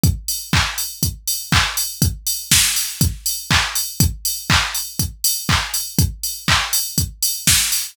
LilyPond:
\new DrumStaff \drummode { \time 4/4 \tempo 4 = 121 <hh bd>8 hho8 <hc bd>8 hho8 <hh bd>8 hho8 <hc bd>8 hho8 | <hh bd>8 hho8 <bd sn>8 hho8 <hh bd>8 hho8 <hc bd>8 hho8 | <hh bd>8 hho8 <hc bd>8 hho8 <hh bd>8 hho8 <hc bd>8 hho8 | <hh bd>8 hho8 <hc bd>8 hho8 <hh bd>8 hho8 <bd sn>8 hho8 | }